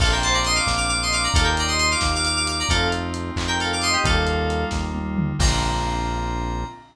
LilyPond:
<<
  \new Staff \with { instrumentName = "Electric Piano 2" } { \time 6/8 \key bes \major \tempo 4. = 89 <a' f''>16 <bes' g''>16 <c'' a''>16 <d'' bes''>16 <ees'' c'''>16 <f'' d'''>8 <f'' d'''>16 <f'' d'''>16 <ees'' c'''>16 <f'' d'''>16 <d'' bes''>16 | <a' f''>16 <bes' g''>16 <d'' bes''>16 <ees'' c'''>16 <ees'' c'''>16 <f'' d'''>8 <f'' d'''>16 <f'' d'''>16 <f'' d'''>16 <f'' d'''>16 <d'' bes''>16 | <a' f''>8 r4 r16 <bes' g''>16 <a' f''>16 <f'' d'''>16 <ees'' c'''>16 <g' ees''>16 | <a' f''>4. r4. |
bes''2. | }
  \new Staff \with { instrumentName = "Electric Piano 2" } { \time 6/8 \key bes \major <bes c' d' f'>2. | <bes ees' f' g'>2. | <a c' ees' f'>2. | <g bes ees' f'>2. |
<bes c' d' f'>2. | }
  \new Staff \with { instrumentName = "Synth Bass 1" } { \clef bass \time 6/8 \key bes \major bes,,4. bes,,4. | ees,4. ees,4. | f,4. f,4. | ees,4. ees,4. |
bes,,2. | }
  \new DrumStaff \with { instrumentName = "Drums" } \drummode { \time 6/8 <cymc bd>8 hh8 hh8 <bd sn>8 hh8 hh8 | <hh bd>8 hh8 hh8 <bd sn>8 hh8 hh8 | <hh bd>8 hh8 hh8 <hc bd>8 hh8 hh8 | <hh bd>8 hh8 hh8 <bd sn>8 tommh8 toml8 |
<cymc bd>4. r4. | }
>>